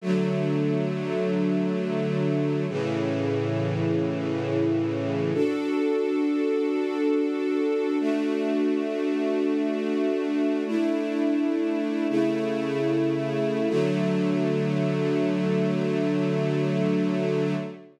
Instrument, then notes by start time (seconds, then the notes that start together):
string ensemble 1
0.01 D3 F#3 A3
2.68 A2 C#3 E3
5.34 D4 F#4 A4
8.00 A3 D4 F#4
10.67 A3 D4 E4
12.09 C#3 A3 E4
13.69 D3 F#3 A3